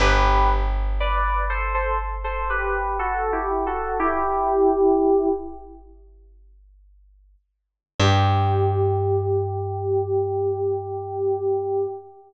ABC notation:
X:1
M:4/4
L:1/16
Q:1/4=60
K:G
V:1 name="Electric Piano 2"
[GB]2 z2 [Bd]2 [Ac] [Ac] z [Ac] [GB]2 (3[FA]2 [EG]2 [FA]2 | [EG]6 z10 | G16 |]
V:2 name="Electric Bass (finger)" clef=bass
G,,,16- | G,,,16 | G,,16 |]